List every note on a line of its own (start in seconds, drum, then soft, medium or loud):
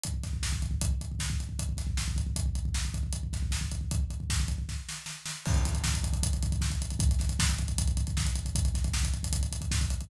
0.03 kick medium
0.03 closed hi-hat medium
0.14 kick medium
0.23 kick medium
0.23 snare soft
0.23 closed hi-hat medium
0.33 kick medium
0.43 kick medium
0.43 snare medium
0.52 kick medium
0.62 kick medium
0.62 closed hi-hat medium
0.71 kick medium
0.81 kick medium
0.81 closed hi-hat medium
0.91 kick medium
1.01 kick medium
1.01 closed hi-hat medium
1.11 kick medium
1.19 kick medium
1.19 snare medium
1.30 kick medium
1.40 kick medium
1.40 closed hi-hat soft
1.49 kick medium
1.59 kick medium
1.59 closed hi-hat medium
1.69 kick medium
1.77 kick medium
1.77 snare soft
1.77 closed hi-hat medium
1.87 kick medium
1.97 kick medium
1.97 snare medium
2.08 kick medium
2.16 kick medium
2.16 closed hi-hat medium
2.26 kick medium
2.36 kick medium
2.36 closed hi-hat medium
2.46 kick medium
2.55 kick medium
2.55 closed hi-hat medium
2.65 kick medium
2.74 kick medium
2.74 snare medium
2.85 kick medium
2.94 kick medium
2.94 closed hi-hat medium
3.03 kick medium
3.13 kick medium
3.13 closed hi-hat medium
3.23 kick medium
3.33 kick medium
3.33 snare soft
3.33 closed hi-hat medium
3.42 kick medium
3.51 kick medium
3.51 snare medium
3.61 kick medium
3.71 kick medium
3.71 closed hi-hat medium
3.81 kick medium
3.91 kick medium
3.91 closed hi-hat medium
4.00 kick medium
4.10 kick medium
4.10 closed hi-hat soft
4.20 kick medium
4.30 kick medium
4.30 snare medium
4.40 kick medium
4.48 kick medium
4.48 closed hi-hat medium
4.58 kick medium
4.69 kick medium
4.69 snare medium
4.89 snare medium
5.06 snare medium
5.26 snare medium
5.45 kick loud
5.45 crash medium
5.54 kick medium
5.54 closed hi-hat medium
5.65 kick medium
5.65 snare soft
5.65 closed hi-hat medium
5.74 kick medium
5.74 closed hi-hat medium
5.84 kick medium
5.84 snare loud
5.94 kick medium
5.94 closed hi-hat medium
6.04 kick medium
6.04 closed hi-hat medium
6.13 kick medium
6.13 closed hi-hat medium
6.23 kick medium
6.23 closed hi-hat loud
6.33 kick medium
6.33 closed hi-hat medium
6.43 kick medium
6.43 closed hi-hat medium
6.52 kick medium
6.52 closed hi-hat medium
6.61 kick medium
6.61 snare medium
6.70 kick medium
6.70 closed hi-hat medium
6.82 kick medium
6.82 closed hi-hat medium
6.90 kick medium
6.90 closed hi-hat medium
6.99 kick loud
6.99 closed hi-hat medium
7.09 kick medium
7.09 closed hi-hat medium
7.19 kick medium
7.19 snare soft
7.19 closed hi-hat medium
7.29 kick medium
7.29 closed hi-hat medium
7.39 kick medium
7.39 snare loud
7.49 kick medium
7.49 closed hi-hat medium
7.58 kick medium
7.58 closed hi-hat medium
7.68 kick medium
7.68 closed hi-hat medium
7.78 kick medium
7.78 closed hi-hat loud
7.88 kick medium
7.88 closed hi-hat medium
7.97 kick medium
7.97 closed hi-hat medium
8.07 kick medium
8.07 closed hi-hat medium
8.17 kick medium
8.17 snare medium
8.25 kick medium
8.25 closed hi-hat medium
8.35 kick medium
8.35 closed hi-hat medium
8.45 kick medium
8.45 closed hi-hat medium
8.55 kick medium
8.55 closed hi-hat medium
8.65 kick medium
8.65 closed hi-hat medium
8.74 kick medium
8.74 snare soft
8.74 closed hi-hat medium
8.84 kick medium
8.84 closed hi-hat medium
8.93 kick medium
8.93 snare medium
9.03 kick medium
9.03 closed hi-hat medium
9.14 kick medium
9.14 closed hi-hat medium
9.23 kick medium
9.23 closed hi-hat medium
9.33 kick medium
9.33 closed hi-hat medium
9.41 kick medium
9.41 closed hi-hat medium
9.52 kick medium
9.52 closed hi-hat medium
9.61 kick medium
9.61 closed hi-hat medium
9.71 kick medium
9.71 snare medium
9.81 kick medium
9.81 closed hi-hat medium
9.90 kick medium
9.90 closed hi-hat medium
10.01 kick medium
10.01 closed hi-hat medium